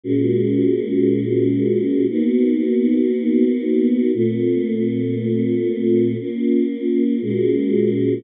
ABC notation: X:1
M:4/4
L:1/8
Q:1/4=117
K:Bbm
V:1 name="Choir Aahs"
[B,,A,DG]8 | [B,_CEG]8 | [B,,=A,CF]8 | [B,DF]4 [B,,A,DG]4 |]